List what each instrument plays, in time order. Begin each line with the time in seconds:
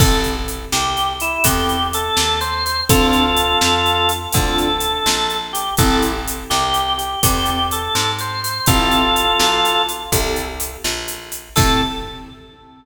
0.00 electric bass (finger) A1, acoustic grand piano C4 E4 G4 A4, drawbar organ A4, kick, crash
0.24 closed hi-hat
0.48 closed hi-hat
0.72 electric bass (finger) C2, drawbar organ G4, snare
0.97 closed hi-hat
1.20 drawbar organ E4, closed hi-hat
1.44 electric bass (finger) E2, acoustic grand piano C4 E4 G4 A4, drawbar organ G4, kick, closed hi-hat
1.69 closed hi-hat
1.93 drawbar organ A4, closed hi-hat
2.17 electric bass (finger) D#2, snare
2.41 drawbar organ C5, closed hi-hat
2.66 closed hi-hat
2.89 electric bass (finger) D2, acoustic grand piano C4 D4 F4 A4, drawbar organ F4 A4, kick, closed hi-hat
3.13 closed hi-hat
3.37 closed hi-hat
3.61 electric bass (finger) F2, snare
3.86 closed hi-hat
4.09 closed hi-hat
4.33 electric bass (finger) D2, acoustic grand piano C4 D4 F4 A4, drawbar organ A4, kick, closed hi-hat
4.58 closed hi-hat
4.80 closed hi-hat
5.06 electric bass (finger) A#1, snare
5.30 closed hi-hat
5.53 drawbar organ G4, closed hi-hat
5.77 electric bass (finger) A1, acoustic grand piano C4 E4 G4 A4, drawbar organ A4, kick, closed hi-hat
6.02 closed hi-hat
6.28 closed hi-hat
6.50 electric bass (finger) C2, drawbar organ G4, snare
6.74 closed hi-hat
6.98 drawbar organ G4, closed hi-hat
7.23 electric bass (finger) E2, acoustic grand piano C4 E4 G4 A4, drawbar organ G4, kick, closed hi-hat
7.46 closed hi-hat
7.71 drawbar organ A4, closed hi-hat
7.95 electric bass (finger) G#2, snare
8.19 drawbar organ C5, closed hi-hat
8.44 closed hi-hat
8.66 electric bass (finger) A1, acoustic grand piano C4 E4 G4 A4, drawbar organ F4 A4, kick, closed hi-hat
8.91 closed hi-hat
9.16 closed hi-hat
9.39 electric bass (finger) B1, snare
9.65 closed hi-hat
9.89 closed hi-hat
10.12 electric bass (finger) C2, acoustic grand piano C4 E4 G4 A4, kick, closed hi-hat
10.36 closed hi-hat
10.60 closed hi-hat
10.84 electric bass (finger) A#1, snare
11.08 closed hi-hat
11.32 closed hi-hat
11.56 electric bass (finger) A2, acoustic grand piano C4 E4 G4 A4, drawbar organ A4, kick, crash